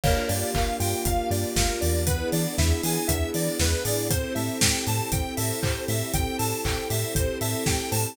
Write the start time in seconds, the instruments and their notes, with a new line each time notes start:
0.03 synth bass 1 G1, electric piano 1 A#3, string ensemble 1 A#3 D4 F4 G4, lead 1 (square) A#4, kick, crash
0.28 synth bass 1 G2, electric piano 1 G4, lead 1 (square) D5, open hi-hat
0.54 synth bass 1 G1, electric piano 1 A#3, lead 1 (square) F5, kick, clap
0.80 synth bass 1 G2, electric piano 1 F4, lead 1 (square) G5, open hi-hat
1.05 synth bass 1 G1, electric piano 1 A#3, lead 1 (square) F5, kick, closed hi-hat
1.30 synth bass 1 G2, electric piano 1 G4, lead 1 (square) D5, open hi-hat
1.56 synth bass 1 G1, electric piano 1 F4, lead 1 (square) A#4, kick, snare
1.81 synth bass 1 E2, electric piano 1 A#3, lead 1 (square) D5, open hi-hat
2.06 electric piano 1 B3, string ensemble 1 B3 D4 E4 G#4, lead 1 (square) B4, kick, closed hi-hat
2.32 synth bass 1 E3, electric piano 1 D4, lead 1 (square) D5, open hi-hat
2.58 synth bass 1 E2, electric piano 1 E4, lead 1 (square) E5, kick, snare
2.83 synth bass 1 E3, electric piano 1 G#4, lead 1 (square) G#5, open hi-hat
3.08 synth bass 1 E2, electric piano 1 B3, lead 1 (square) E5, kick, closed hi-hat
3.34 synth bass 1 E3, electric piano 1 D4, lead 1 (square) D5, open hi-hat
3.59 synth bass 1 E2, electric piano 1 E4, lead 1 (square) B4, kick, snare
3.85 synth bass 1 A1, electric piano 1 G#4, lead 1 (square) D5, open hi-hat
4.10 electric piano 1 C4, string ensemble 1 C4 E4 G4 A4, lead 1 (square) C5, kick, closed hi-hat
4.35 synth bass 1 A2, electric piano 1 A4, lead 1 (square) E5, open hi-hat
4.61 synth bass 1 A1, electric piano 1 C4, lead 1 (square) G5, kick, snare
4.87 synth bass 1 A2, electric piano 1 G4, lead 1 (square) A5, open hi-hat
5.11 synth bass 1 A1, electric piano 1 C4, lead 1 (square) G5, kick, closed hi-hat
5.37 synth bass 1 A2, electric piano 1 A4, lead 1 (square) E5, open hi-hat
5.62 synth bass 1 A1, electric piano 1 G4, lead 1 (square) C5, kick, clap
5.88 synth bass 1 A2, electric piano 1 C4, lead 1 (square) E5, open hi-hat
6.14 synth bass 1 A1, electric piano 1 C4, lead 1 (square) G5, kick, closed hi-hat
6.38 synth bass 1 A2, electric piano 1 A4, lead 1 (square) A5, open hi-hat
6.65 synth bass 1 A1, electric piano 1 C4, lead 1 (square) G5, kick, clap
6.90 synth bass 1 A2, electric piano 1 G4, lead 1 (square) E5, open hi-hat
7.15 synth bass 1 A1, electric piano 1 C4, lead 1 (square) C5, kick, closed hi-hat
7.41 synth bass 1 A2, electric piano 1 A4, lead 1 (square) E5, open hi-hat
7.66 synth bass 1 A1, electric piano 1 G4, lead 1 (square) G5, kick, snare
7.92 synth bass 1 A2, electric piano 1 C4, lead 1 (square) A5, open hi-hat